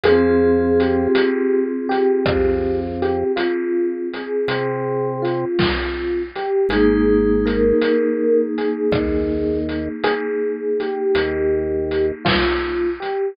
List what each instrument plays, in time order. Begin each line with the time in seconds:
0.03 drawbar organ F2, vibraphone F4 G#4, electric piano 1 G#4, closed hi-hat
0.09 vibraphone C4
0.80 electric piano 1 G4, closed hi-hat
1.15 closed hi-hat
1.89 electric piano 1 G4, closed hi-hat
2.25 drawbar organ F2, kick, cross-stick
3.02 electric piano 1 G4, closed hi-hat
3.36 electric piano 1 F4, closed hi-hat
4.13 electric piano 1 G#4, closed hi-hat
4.48 drawbar organ C3, closed hi-hat
5.22 electric piano 1 F4, closed hi-hat
5.59 kick, snare
6.35 electric piano 1 G4, closed hi-hat
6.69 drawbar organ G#1, vibraphone D#4 G#4, electric piano 1 G#4, closed hi-hat
6.75 vibraphone A#3
7.45 electric piano 1 A#4, closed hi-hat
7.81 closed hi-hat
8.58 electric piano 1 G#4, closed hi-hat
8.92 drawbar organ D#2, kick, cross-stick
9.69 closed hi-hat
10.03 electric piano 1 G#4, closed hi-hat
10.80 electric piano 1 G4, closed hi-hat
11.15 drawbar organ D#2, closed hi-hat
11.91 closed hi-hat
12.25 electric piano 1 F4, kick, snare
13.00 electric piano 1 G4, closed hi-hat